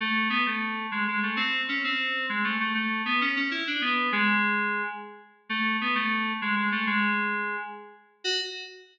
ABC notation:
X:1
M:9/8
L:1/8
Q:3/8=131
K:F#m
V:1 name="Electric Piano 2"
A,2 B, A,3 G, G, A, | ^B,2 C B,3 G, A, A, | A,2 B, C C E D B,2 | G,5 z4 |
A,2 B, A,3 G, G, A, | G,5 z4 | F3 z6 |]